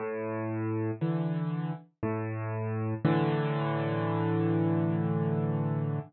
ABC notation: X:1
M:3/4
L:1/8
Q:1/4=59
K:A
V:1 name="Acoustic Grand Piano" clef=bass
A,,2 [D,E,]2 A,,2 | [A,,D,E,]6 |]